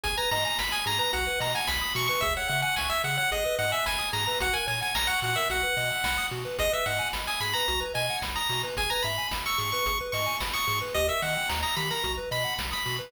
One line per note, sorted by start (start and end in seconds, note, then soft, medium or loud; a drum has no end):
0.04 0.19 G#1 loud
0.04 0.16 G#4 loud
0.04 0.17 G#5 medium
0.04 kick loud
0.04 closed hi-hat loud
0.18 0.30 B4 medium
0.18 0.30 A#5 medium
0.31 0.46 G#2 medium
0.31 0.44 D#5 medium
0.31 0.44 A#5 medium
0.31 open hi-hat medium
0.45 0.57 G#5 medium
0.45 0.58 A#5 medium
0.59 0.74 G#1 medium
0.59 0.71 B5 medium
0.59 0.72 B5 medium
0.59 kick medium
0.59 snare loud
0.72 0.85 G#5 medium
0.72 0.84 D#6 medium
0.86 1.01 G#2 medium
0.86 0.98 G#4 medium
0.86 0.99 A#5 medium
0.86 open hi-hat medium
0.99 1.11 B4 medium
0.99 1.12 A#5 medium
1.13 1.28 B1 loud
1.13 1.25 F#4 loud
1.13 1.40 F#5 medium
1.13 kick medium
1.13 closed hi-hat loud
1.27 1.39 B4 medium
1.39 1.55 B2 medium
1.39 1.52 D#5 medium
1.39 1.54 A#5 medium
1.39 open hi-hat medium
1.54 1.67 F#5 medium
1.54 1.68 G#5 medium
1.67 1.83 B1 loud
1.67 1.92 B5 medium
1.67 1.81 B5 medium
1.67 kick medium
1.67 snare loud
1.82 1.94 D#6 medium
1.95 2.10 B2 loud
1.95 2.07 F#4 medium
1.95 2.07 C#6 medium
1.95 open hi-hat medium
2.08 2.21 B4 medium
2.08 2.21 C#6 medium
2.21 2.37 C#2 loud
2.21 2.35 G#4 loud
2.21 2.34 E5 medium
2.21 kick loud
2.21 closed hi-hat medium
2.37 2.49 C#5 medium
2.37 2.48 F#5 medium
2.48 2.65 C#3 loud
2.48 2.61 E5 medium
2.48 2.61 F#5 medium
2.48 open hi-hat medium
2.62 2.75 F#5 medium
2.62 2.74 G#5 medium
2.76 2.92 C#2 medium
2.76 2.89 G#5 medium
2.76 2.90 C#6 medium
2.76 kick medium
2.76 snare loud
2.90 3.02 E5 medium
2.90 3.03 E6 medium
3.04 3.19 C#3 loud
3.04 3.16 G#4 medium
3.04 3.17 F#5 medium
3.04 open hi-hat medium
3.17 3.30 C#5 medium
3.17 3.30 F#5 medium
3.31 3.46 G#1 loud
3.31 3.44 G#4 loud
3.31 3.56 D#5 medium
3.31 kick medium
3.31 closed hi-hat medium
3.45 3.57 B4 medium
3.59 3.74 G#2 loud
3.59 3.71 D#5 medium
3.59 3.72 F#5 medium
3.59 open hi-hat medium
3.72 3.85 E5 medium
3.72 3.84 G#5 medium
3.86 4.01 G#1 loud
3.86 4.09 G#5 medium
3.86 3.98 B5 medium
3.86 kick medium
3.86 snare loud
3.99 4.11 D#6 medium
4.13 4.28 G#2 loud
4.13 4.25 G#4 medium
4.13 4.25 A#5 medium
4.13 open hi-hat medium
4.26 4.40 B4 medium
4.26 4.39 A#5 medium
4.40 4.55 A#1 loud
4.40 4.53 F#4 medium
4.40 4.55 F#5 medium
4.40 kick loud
4.40 closed hi-hat loud
4.53 4.66 A#4 medium
4.53 4.66 G#5 medium
4.67 4.83 A#2 medium
4.67 4.79 C#5 medium
4.67 4.81 G#5 medium
4.67 open hi-hat medium
4.81 4.93 F#5 medium
4.81 4.95 G#5 medium
4.95 5.10 A#1 loud
4.95 5.08 A#5 medium
4.95 5.07 A#5 medium
4.95 kick medium
4.95 snare loud
5.07 5.20 F#5 medium
5.07 5.21 C#6 medium
5.22 5.37 A#2 loud
5.22 5.35 F#4 medium
5.22 5.37 F#5 medium
5.22 open hi-hat medium
5.36 5.48 A#4 medium
5.36 5.49 E5 medium
5.50 5.65 B1 loud
5.50 5.62 F#4 loud
5.50 6.27 F#5 medium
5.50 kick medium
5.50 closed hi-hat medium
5.63 5.75 B4 medium
5.77 5.92 B2 loud
5.77 5.89 D#5 medium
5.77 open hi-hat medium
5.91 6.03 F#5 medium
6.04 6.19 B1 loud
6.04 6.17 B5 medium
6.04 kick medium
6.04 snare loud
6.18 6.30 D#6 medium
6.31 6.46 B2 loud
6.31 6.44 F#4 medium
6.31 open hi-hat medium
6.45 6.57 B4 medium
6.59 6.74 G#1 loud
6.59 6.71 G#4 loud
6.59 6.72 D#5 medium
6.59 kick loud
6.59 closed hi-hat loud
6.72 6.84 B4 medium
6.72 6.86 E5 medium
6.86 7.01 G#2 loud
6.86 6.99 D#5 medium
6.86 7.09 F#5 medium
6.86 open hi-hat medium
6.99 7.11 G#5 medium
7.13 7.28 G#1 loud
7.13 7.26 B5 medium
7.13 kick medium
7.13 snare loud
7.27 7.40 G#5 medium
7.27 7.40 D#6 medium
7.40 7.55 G#2 medium
7.40 7.54 G#4 medium
7.40 7.54 B5 medium
7.40 open hi-hat medium
7.53 7.67 B4 medium
7.53 7.80 A#5 medium
7.68 7.83 B1 loud
7.68 7.80 F#4 loud
7.68 kick medium
7.68 closed hi-hat medium
7.80 7.93 B4 medium
7.94 8.10 B2 medium
7.94 8.06 D#5 medium
7.94 8.17 G#5 medium
7.94 open hi-hat medium
8.10 8.22 F#5 medium
8.22 8.37 B1 loud
8.22 8.35 B5 medium
8.22 kick medium
8.22 snare loud
8.36 8.62 A#5 medium
8.36 8.48 D#6 medium
8.49 8.64 B2 loud
8.49 8.62 F#4 medium
8.49 open hi-hat medium
8.63 8.76 B4 medium
8.77 8.92 G#1 loud
8.77 8.90 G#4 loud
8.77 8.90 G#5 medium
8.77 kick loud
8.77 closed hi-hat loud
8.90 9.03 B4 medium
8.90 9.03 A#5 medium
9.03 9.19 G#2 medium
9.03 9.17 E5 medium
9.03 9.27 B5 medium
9.03 open hi-hat medium
9.18 9.30 G#5 medium
9.31 9.46 G#1 medium
9.31 9.44 B5 medium
9.31 kick medium
9.31 snare loud
9.46 9.58 C#6 medium
9.46 9.58 E6 medium
9.58 9.74 G#2 medium
9.58 9.70 G#4 medium
9.58 9.71 C#6 medium
9.58 open hi-hat medium
9.72 9.85 B4 medium
9.72 9.97 C#6 medium
9.86 10.01 G#1 loud
9.86 9.99 G#4 medium
9.86 kick medium
9.86 closed hi-hat loud
10.01 10.13 B4 medium
10.12 10.28 G#2 medium
10.12 10.26 D#5 medium
10.12 10.36 C#6 medium
10.12 open hi-hat medium
10.26 10.39 G#5 medium
10.40 10.55 G#1 loud
10.40 10.53 B5 medium
10.40 kick medium
10.40 snare loud
10.53 10.79 C#6 medium
10.53 10.66 D#6 medium
10.67 10.83 G#2 loud
10.67 10.79 G#4 medium
10.67 open hi-hat medium
10.81 10.94 B4 medium
10.94 11.10 D#2 loud
10.94 11.07 G4 loud
10.94 11.07 D#5 medium
10.94 kick loud
10.94 closed hi-hat medium
11.08 11.20 A#4 medium
11.08 11.22 E5 medium
11.22 11.37 D#3 loud
11.22 11.34 D#5 medium
11.22 11.49 F#5 medium
11.22 open hi-hat medium
11.36 11.48 G5 medium
11.49 11.65 D#2 loud
11.49 11.61 A#5 medium
11.49 kick medium
11.49 snare loud
11.63 11.76 A#5 medium
11.63 11.75 D#6 medium
11.76 11.92 D#3 loud
11.76 11.89 G4 medium
11.76 11.89 B5 medium
11.76 open hi-hat medium
11.91 12.03 A#4 medium
11.91 12.13 A#5 medium
12.03 12.19 B1 loud
12.03 12.16 F#4 medium
12.03 kick medium
12.03 closed hi-hat medium
12.17 12.30 B4 medium
12.31 12.46 B2 loud
12.31 12.43 D#5 medium
12.31 12.54 B5 medium
12.31 open hi-hat medium
12.44 12.56 F#5 medium
12.58 12.74 B1 loud
12.58 12.70 B5 medium
12.58 kick medium
12.58 snare loud
12.71 12.95 B5 medium
12.71 12.84 D#6 medium
12.85 13.01 B2 loud
12.85 12.98 F#4 medium
12.85 open hi-hat medium
12.99 13.11 B4 medium